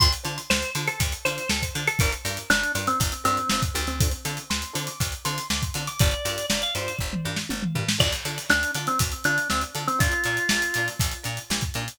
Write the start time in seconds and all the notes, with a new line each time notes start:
0.00 D2 D4 F4 A4 C5 C6, kick, closed hi-hat
0.12 closed hi-hat
0.24 D3 D4 F4 A4 C5, closed hi-hat
0.38 closed hi-hat
0.50 D2 C5, snare
0.62 closed hi-hat
0.75 D3 D4 F4 A4 C5, closed hi-hat
0.88 A4, closed hi-hat
1.00 D2, kick, closed hi-hat
1.12 closed hi-hat
1.25 D3 D4 F4 A4 C5, closed hi-hat
1.38 closed hi-hat
1.49 D2 A4, snare
1.62 kick, closed hi-hat
1.74 D3 D4 F4 A4 C5, closed hi-hat
1.87 A4, closed hi-hat
1.99 G1 D4 F4 G4 A#4, kick, closed hi-hat
2.12 closed hi-hat
2.25 G2 D4 F4 G4 A#4, closed hi-hat
2.37 closed hi-hat
2.50 G1 D4, snare
2.64 closed hi-hat
2.75 G2 D4 F4 G4 A#4, closed hi-hat
2.87 C4, closed hi-hat
3.00 G1, kick, closed hi-hat
3.12 closed hi-hat
3.24 G2 C4 D4 F4 G4 A#4, closed hi-hat
3.37 closed hi-hat
3.49 G1 C4, snare
3.62 kick, closed hi-hat
3.74 D2 D4 F4 G4 A#4, closed hi-hat
3.87 C4, closed hi-hat
4.00 C4 D4 F4 A4 C5, kick, closed hi-hat
4.11 closed hi-hat
4.25 D3 C4 D4 F4 A4, closed hi-hat
4.37 closed hi-hat
4.50 D2 C6, snare
4.62 closed hi-hat
4.73 D3 C4 D4 F4 A4, closed hi-hat
4.87 D6, closed hi-hat
5.00 D2, kick, closed hi-hat
5.12 closed hi-hat
5.25 D3 C4 D4 F4 A4 C6, closed hi-hat
5.38 closed hi-hat
5.50 D2 D6, snare
5.62 kick, closed hi-hat
5.74 D3 C4 D4 F4 A4, closed hi-hat
5.87 D6, closed hi-hat
5.99 G1 D4 F4 G4 A#4 D5, kick, closed hi-hat
6.11 closed hi-hat
6.25 G2 D4 F4 G4 A#4, closed hi-hat
6.38 closed hi-hat
6.50 G1 D5, snare
6.62 F5, closed hi-hat
6.75 G2 D4 F4 G4 A#4 C5, closed hi-hat
6.88 closed hi-hat
6.99 G1, kick
7.13 mid tom
7.25 G2 D4 F4 G4 A#4
7.36 snare
7.49 G1, high tom
7.62 mid tom
7.75 G2 D4 F4 G4 A#4, floor tom
7.89 snare
7.98 D2 D4 F4 A4 D5, kick, crash
8.12 snare, closed hi-hat
8.25 D3 D4 F4 A4, closed hi-hat
8.38 closed hi-hat
8.50 D2 D4, snare
8.63 closed hi-hat
8.74 D3 D4 F4 A4, snare, closed hi-hat
8.87 C4, closed hi-hat
8.99 D2, kick, closed hi-hat
9.12 closed hi-hat
9.24 D3 D4 F4 A4, closed hi-hat
9.38 closed hi-hat
9.50 D2 C4, snare
9.61 closed hi-hat
9.74 D3 D4 F4 A4, closed hi-hat
9.88 C4, closed hi-hat
9.99 A#1 D4 F4 A#4, kick, closed hi-hat
10.12 closed hi-hat
10.24 A#2 D4 F4 A#4, closed hi-hat
10.37 closed hi-hat
10.49 A#1, snare
10.62 snare, closed hi-hat
10.74 A#2 D4 F4 A#4, closed hi-hat
10.88 snare, closed hi-hat
10.99 A#1, kick, closed hi-hat
11.11 closed hi-hat
11.23 A#2 D4 F4 A#4, closed hi-hat
11.37 closed hi-hat
11.50 A#1, snare
11.61 kick, closed hi-hat
11.74 A#2 D4 F4 A#4, closed hi-hat
11.88 closed hi-hat